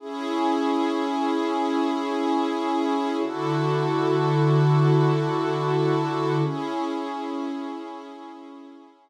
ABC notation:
X:1
M:4/4
L:1/8
Q:1/4=75
K:C#phr
V:1 name="Pad 2 (warm)"
[CEG]8 | [D,EFA]8 | [CEG]8 |]